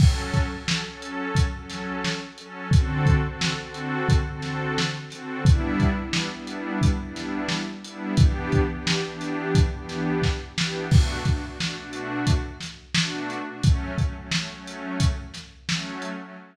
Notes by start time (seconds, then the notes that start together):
0.00 F#3 C#4 A4, kick, crash
0.34 kick, closed hi-hat
0.55 F#3 C#4 A4
0.68 snare
0.88 F#3 C#4 A4
1.02 closed hi-hat
1.35 kick, closed hi-hat
1.57 F#3 C#4 A4
1.70 snare, closed hi-hat
2.04 snare
2.38 F#3 C#4 A4, closed hi-hat
2.71 D3 C4 F#4 A4, kick, closed hi-hat
3.06 kick, closed hi-hat
3.27 D3 C4 F#4 A4
3.41 snare
3.62 D3 C4 F#4 A4
3.74 closed hi-hat
4.09 kick, closed hi-hat
4.29 D3 C4 F#4 A4
4.42 snare, closed hi-hat
4.78 snare
5.10 D3 C4 F#4 A4, snare, closed hi-hat
5.45 G3 B3 D4 E4, kick, closed hi-hat
5.80 kick, closed hi-hat
6.01 G3 B3 D4 E4
6.13 snare
6.35 G3 B3 D4 E4
6.47 closed hi-hat
6.82 kick, closed hi-hat
7.02 G3 B3 D4 E4
7.16 snare, closed hi-hat
7.49 snare
7.84 G3 B3 D4 E4, closed hi-hat
8.17 E3 B3 D4 G4, kick, closed hi-hat
8.52 kick, closed hi-hat
8.72 E3 B3 D4 G4
8.87 snare
9.06 E3 B3 D4 G4
9.21 snare, closed hi-hat
9.55 kick, closed hi-hat
9.74 E3 B3 D4 G4
9.89 snare, closed hi-hat
10.22 kick, snare
10.58 E3 B3 D4 G4, snare
10.91 B2 A3 D4 F#4, kick, crash
11.25 B2 A3 D4 F#4, kick, closed hi-hat
11.46 B2 A3 D4 F#4
11.59 B2 A3 D4 F#4, snare
11.79 B2 A3 D4 F#4
11.93 closed hi-hat
12.27 kick, closed hi-hat
12.61 snare, closed hi-hat
12.94 B2 A3 D4 F#4, snare
13.30 closed hi-hat
13.50 B2 A3 D4 F#4
13.63 F#3 A3 C#4, kick, closed hi-hat
13.97 F#3 A3 C#4, kick, closed hi-hat
14.17 F#3 A3 C#4
14.32 F#3 A3 C#4, snare
14.52 F#3 A3 C#4
14.67 closed hi-hat
15.00 kick, closed hi-hat
15.34 snare, closed hi-hat
15.67 F#3 A3 C#4, snare
16.02 closed hi-hat
16.23 F#3 A3 C#4